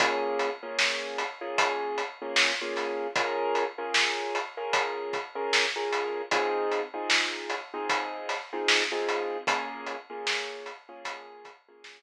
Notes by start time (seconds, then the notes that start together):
0.00 A#3 C#4 F4 G#4, kick, closed hi-hat
0.39 closed hi-hat
0.63 A#3 C#4 F4 G#4
0.79 snare
1.18 closed hi-hat
1.41 A#3 C#4 F4 G#4
1.58 kick, closed hi-hat
1.98 closed hi-hat
2.22 A#3 C#4 F4 G#4
2.36 snare
2.61 A#3 C#4 F4 G#4
2.76 snare, closed hi-hat
3.15 C#4 F4 G#4 A#4, kick, closed hi-hat
3.55 closed hi-hat
3.78 C#4 F4 G#4 A#4
3.94 snare
4.35 closed hi-hat
4.57 C#4 F4 G#4 A#4
4.73 kick, closed hi-hat
5.13 kick, closed hi-hat
5.35 C#4 F4 G#4 A#4
5.53 snare
5.76 C#4 F4 G#4 A#4
5.92 closed hi-hat
6.31 C4 D#4 F4 G#4, kick, closed hi-hat
6.72 closed hi-hat
6.94 C4 D#4 F4 G#4
7.10 snare
7.50 closed hi-hat
7.73 C4 D#4 F4 G#4
7.89 kick, closed hi-hat
8.29 snare, closed hi-hat
8.52 C4 D#4 F4 G#4
8.68 snare
8.91 C4 D#4 F4 G#4
9.09 closed hi-hat
9.47 A#3 C#4 F4 G#4, kick, closed hi-hat
9.86 closed hi-hat
10.10 A#3 C#4 F4 G#4
10.27 snare
10.66 closed hi-hat
10.89 A#3 C#4 F4 G#4
11.05 kick, closed hi-hat
11.45 kick, closed hi-hat
11.68 A#3 C#4 F4 G#4
11.84 snare